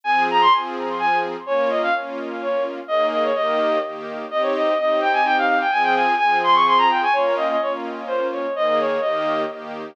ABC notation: X:1
M:3/4
L:1/16
Q:1/4=127
K:Ab
V:1 name="Violin"
a2 b c' z4 a2 z2 | d2 e f z4 d2 z2 | e2 e d e4 z4 | e d e2 e2 g a g f f g |
a g a2 a2 c' d' c' b g a | d2 e e d z3 c2 d2 | e e d2 e4 z4 |]
V:2 name="String Ensemble 1"
[F,CA]4 [F,CA]8 | [B,DF]4 [B,DF]8 | [E,B,A]4 [E,B,G]4 [E,B,G]4 | [CEG]4 [CEG]8 |
[F,CA]4 [F,CA]8 | [B,DF]4 [B,DF]8 | [E,B,A]4 [E,B,G]4 [E,B,G]4 |]